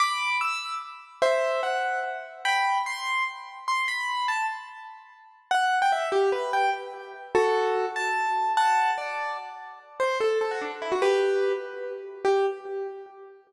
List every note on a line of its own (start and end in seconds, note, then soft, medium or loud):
0.00 0.37 B5 medium
0.00 0.37 D6 loud
0.41 0.75 E6 medium
1.22 1.61 C5 medium
1.22 1.61 E5 loud
1.63 2.00 F#5 medium
2.45 2.78 G5 medium
2.45 2.78 B5 loud
2.86 3.24 C6 loud
3.68 3.86 C6 medium
3.88 4.27 B5 medium
4.28 4.46 A5 medium
5.51 5.79 F#5 loud
5.82 5.92 G5 loud
5.92 6.09 E5 loud
6.12 6.30 G4 loud
6.32 6.52 B4 medium
6.53 6.70 G5 loud
7.35 7.85 F#4 loud
7.35 7.85 A4 loud
7.96 8.52 A5 loud
8.57 8.91 F#5 loud
8.57 8.91 A5 loud
8.98 9.37 D5 medium
10.00 10.18 C5 loud
10.20 10.39 A4 loud
10.41 10.51 A4 medium
10.51 10.61 F#4 medium
10.61 10.71 D4 medium
10.82 10.91 E4 medium
10.92 11.01 F#4 medium
11.02 11.52 G4 loud
11.02 11.52 B4 loud
12.25 12.46 G4 loud